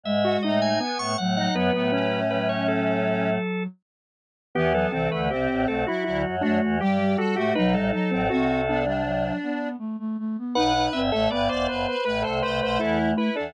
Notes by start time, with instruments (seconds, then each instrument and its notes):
0.03 choir aahs G#2 G#3, flute G#3, drawbar organ E5
0.25 lead 1 (square) F#4
0.42 choir aahs A2 A3, lead 1 (square) D#4, drawbar organ D#5
0.62 drawbar organ G#5
0.80 lead 1 (square) B3, drawbar organ G#5
0.98 choir aahs A2 A3, drawbar organ C#6
1.17 choir aahs A2 A3, flute F#3, drawbar organ F#5
1.36 flute F#3, lead 1 (square) D#4, drawbar organ F#5
1.53 choir aahs F#2 F#3, flute F#3, lead 1 (square) B3, drawbar organ B4
1.73 choir aahs A2 A3, lead 1 (square) B3
1.92 lead 1 (square) C#4
2.30 flute F#3, drawbar organ B4
2.49 drawbar organ C#5
2.68 drawbar organ A4
4.55 choir aahs E2 E3, flute E3, lead 1 (square) B3, drawbar organ G4
4.72 flute F#3, lead 1 (square) B3, drawbar organ A4
4.90 choir aahs C2 C3, flute E3, lead 1 (square) C4, drawbar organ A4
5.11 choir aahs D2 D3, lead 1 (square) A3, drawbar organ B4
5.30 choir aahs C2 C3, lead 1 (square) C4, flute C4, drawbar organ G4
5.48 choir aahs A1 A2
5.67 choir aahs B1 B2, flute A3, drawbar organ A4
5.87 flute F#3, lead 1 (square) E4, drawbar organ F#4
6.04 choir aahs D2 D3, flute F#3, lead 1 (square) E4, drawbar organ F#4
6.25 choir aahs F#2 F#3
6.41 choir aahs F#2 F#3, flute A3, lead 1 (square) D4, drawbar organ F#4
6.62 choir aahs E2 E3
6.80 choir aahs G2 G3, flute G3, drawbar organ G4, lead 1 (square) G4
6.99 flute G3
7.17 flute G3, drawbar organ F#4, lead 1 (square) A4
7.35 choir aahs A2 A3, flute A3, lead 1 (square) F#4, drawbar organ G4
7.55 choir aahs B1 B2, flute F#3, lead 1 (square) D#4, drawbar organ B4
7.73 choir aahs A1 A2, flute G3, drawbar organ A4
7.92 flute F#3, lead 1 (square) D#4
8.11 choir aahs A1 A2, lead 1 (square) C4
8.30 choir aahs C2 C3, flute C4, lead 1 (square) F#4
8.68 flute B3, lead 1 (square) D4
8.84 flute G3, lead 1 (square) D4
9.05 flute F#3
9.43 flute B3
9.79 flute A3
9.99 flute A3
10.19 flute A3
10.38 flute B3
10.55 choir aahs B1 B2, flute D#4, lead 1 (square) B4, drawbar organ F#5
10.75 flute D#4
10.93 choir aahs G1 G2, flute C4, drawbar organ E5
11.10 choir aahs A1 A2, flute A3, lead 1 (square) A4, drawbar organ E5
11.29 choir aahs G1 G2, flute B3, lead 1 (square) B4, drawbar organ D5
11.49 choir aahs E1 E2, drawbar organ C5, lead 1 (square) D5
11.68 choir aahs F#1 F#2, lead 1 (square) B4, drawbar organ C5
11.88 lead 1 (square) B4
12.05 choir aahs A1 A2, flute A3, lead 1 (square) B4, drawbar organ B4
12.22 choir aahs C2 C3, lead 1 (square) A4, drawbar organ C5
12.42 choir aahs C2 C3, drawbar organ B4, lead 1 (square) C5
12.60 choir aahs B1 B2, lead 1 (square) C5
12.79 choir aahs E2 E3, lead 1 (square) E4, drawbar organ A4
13.17 lead 1 (square) E4, drawbar organ B4
13.35 choir aahs E2 E3, lead 1 (square) D4, drawbar organ A4